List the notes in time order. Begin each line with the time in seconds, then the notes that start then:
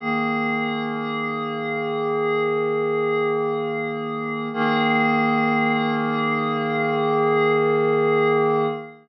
0.00 D#3 A#3 G#4
4.53 D#3 A#3 G#4